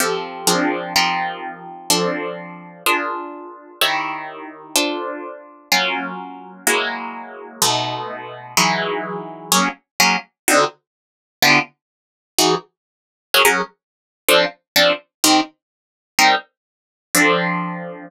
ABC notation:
X:1
M:2/2
L:1/8
Q:1/2=126
K:Fmix
V:1 name="Acoustic Guitar (steel)"
[F,CGA]4 [F,CD_AB]4 | [F,CEGB]8 | [F,CDA]8 | [DF_AB]8 |
[E,_FG_d]8 | [DFAc]8 | [K:F#mix] [F,A,C^E]8 | [F,G,A,E]8 |
[B,,G,=A,D]8 | [E,F,G,D]8 | [F,A,CG]4 [F,A,CG]4 | [=D,=C_EF]8 |
[=D,B,E=F=G]8 | [E,DFG]8 | [F,CGA] [F,CGA]7 | [K:Fmix] [F,CDA]4 [F,CDA]4 |
[E,CGB]8 | [G,CEB]8 | [F,CDA]8 |]